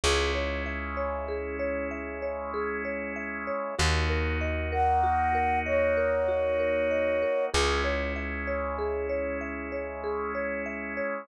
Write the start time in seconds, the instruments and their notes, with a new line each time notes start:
0.04 electric bass (finger) C#2, drawbar organ G#3 C#4 E4, marimba G#4
0.35 marimba C#5
0.66 marimba E5
0.97 marimba C#5
1.28 marimba G#4
1.60 marimba C#5
1.91 marimba E5
2.22 marimba C#5
2.54 marimba G#4
2.85 marimba C#5
3.16 marimba E5
3.47 marimba C#5
3.79 electric bass (finger) D#2, drawbar organ A#3 D#4 F#4, marimba F#4
4.10 marimba A#4
4.41 marimba D#5
4.72 marimba A#4, flute F#5
5.04 marimba F#4
5.35 marimba A#4
5.66 flute C#5, marimba D#5
5.97 marimba A#4
6.28 marimba F#4
6.60 marimba A#4
6.91 marimba D#5
7.22 marimba A#4
7.54 electric bass (finger) C#2, drawbar organ G#3 C#4 E4, marimba G#4
7.84 marimba C#5
8.16 marimba E5
8.47 marimba C#5
8.79 marimba G#4
9.09 marimba C#5
9.41 marimba E5
9.72 marimba C#5
10.04 marimba G#4
10.35 marimba C#5
10.66 marimba E5
10.97 marimba C#5